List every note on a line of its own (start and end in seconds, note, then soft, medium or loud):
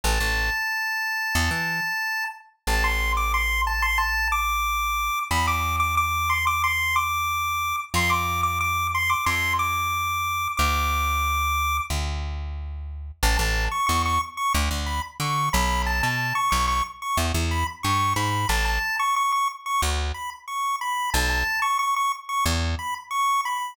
0.04 0.19 A1 medium
0.04 2.24 A5 medium
0.20 0.50 A1 medium
1.35 1.50 E2 medium
1.51 1.80 E3 medium
2.67 5.10 A1 medium
2.67 2.83 A5 loud
2.84 3.12 C6 medium
3.17 3.32 D6 medium
3.34 3.61 C6 medium
3.67 3.82 A5 medium
3.82 3.98 C6 medium
3.98 4.28 A5 medium
4.32 5.19 D6 medium
5.31 7.73 E2 medium
5.31 5.47 B5 loud
5.47 5.76 D6 medium
5.80 5.95 D6 medium
5.97 6.29 D6 medium
6.30 6.45 C6 medium
6.47 6.63 D6 loud
6.64 6.95 C6 medium
6.96 7.76 D6 medium
7.94 9.15 F2 medium
7.94 8.11 C6 loud
8.10 8.41 D6 medium
8.43 8.59 D6 medium
8.61 8.87 D6 medium
8.95 9.10 C6 medium
9.09 9.25 D6 medium
9.26 10.48 F2 medium
9.26 9.53 C6 medium
9.59 10.48 D6 medium
10.57 11.80 D2 medium
10.57 11.77 D6 loud
11.90 13.11 D2 medium
13.23 13.38 A1 loud
13.23 13.37 A5 medium
13.37 13.68 A1 medium
13.37 13.64 A5 medium
13.71 13.86 C#6 medium
13.87 14.19 E2 medium
13.87 14.02 C#6 medium
14.05 14.21 C#6 medium
14.37 14.53 C#6 medium
14.54 14.69 D2 loud
14.71 15.00 D2 medium
14.86 15.02 B5 medium
15.20 15.49 D3 medium
15.20 15.49 C#6 medium
15.53 16.02 B1 loud
15.53 15.82 B5 medium
15.86 16.02 A5 medium
16.03 16.33 B2 medium
16.03 16.34 A5 medium
16.35 16.50 C#6 medium
16.51 16.82 B1 medium
16.51 16.66 C#6 medium
16.68 16.83 C#6 medium
17.02 17.18 C#6 medium
17.17 17.32 E2 medium
17.34 17.64 E2 medium
17.51 17.67 B5 medium
17.83 18.14 G2 medium
17.83 18.13 C#6 medium
18.16 18.46 G#2 medium
18.16 18.48 B5 medium
18.49 18.79 A1 medium
18.49 18.65 A5 medium
18.65 18.96 A5 medium
18.99 19.15 C#6 medium
19.16 19.32 C#6 medium
19.32 19.48 C#6 medium
19.66 19.81 C#6 medium
19.82 20.12 D2 medium
20.14 20.30 B5 medium
20.48 20.76 C#6 medium
20.81 21.10 B5 medium
21.14 21.44 B1 loud
21.14 21.29 A5 medium
21.29 21.60 A5 medium
21.62 21.78 C#6 medium
21.79 21.95 C#6 medium
21.96 22.12 C#6 medium
22.29 22.45 C#6 medium
22.45 22.75 E2 loud
22.79 22.94 B5 medium
23.11 23.41 C#6 medium
23.45 23.74 B5 medium